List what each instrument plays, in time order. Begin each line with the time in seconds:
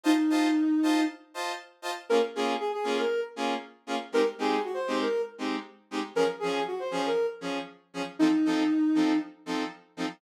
0.03 ocarina D#4, lead 2 (sawtooth) F4 C5 D#5 A5
0.30 lead 2 (sawtooth) F4 C5 D#5 A5
0.83 lead 2 (sawtooth) F4 C5 D#5 A5
1.34 lead 2 (sawtooth) F4 C5 D#5 A5
1.82 lead 2 (sawtooth) F4 C5 D#5 A5
2.09 lead 2 (sawtooth) A#3 C#4 F4 G#4, ocarina A#4
2.35 lead 2 (sawtooth) A#3 C#4 F4 G#4, ocarina G#4
2.59 ocarina G#4
2.72 ocarina G#4
2.84 lead 2 (sawtooth) A#3 C#4 F4 G#4
2.98 ocarina A#4
3.36 lead 2 (sawtooth) A#3 C#4 F4 G#4
3.87 lead 2 (sawtooth) A#3 C#4 F4 G#4
4.12 lead 2 (sawtooth) G#3 C4 D#4 G4, ocarina A#4
4.38 lead 2 (sawtooth) G#3 C4 D#4 G4, ocarina G#4
4.64 ocarina F#4
4.74 ocarina C5
4.87 lead 2 (sawtooth) G#3 C4 D#4 G4
5.00 ocarina A#4
5.38 lead 2 (sawtooth) G#3 C4 D#4 G4
5.91 lead 2 (sawtooth) G#3 C4 D#4 G4
6.15 lead 2 (sawtooth) F3 C#4 G#4, ocarina A#4
6.39 lead 2 (sawtooth) F3 C#4 G#4, ocarina G#4
6.67 ocarina F#4
6.79 ocarina C5
6.91 lead 2 (sawtooth) F3 C#4 G#4
7.06 ocarina A#4
7.41 lead 2 (sawtooth) F3 C#4 G#4
7.94 lead 2 (sawtooth) F3 C#4 G#4
8.19 lead 2 (sawtooth) F3 C4 D#4 A4, ocarina D#4
8.45 lead 2 (sawtooth) F3 C4 D#4 A4
8.95 lead 2 (sawtooth) F3 C4 D#4 A4
9.46 lead 2 (sawtooth) F3 C4 D#4 A4
9.97 lead 2 (sawtooth) F3 C4 D#4 A4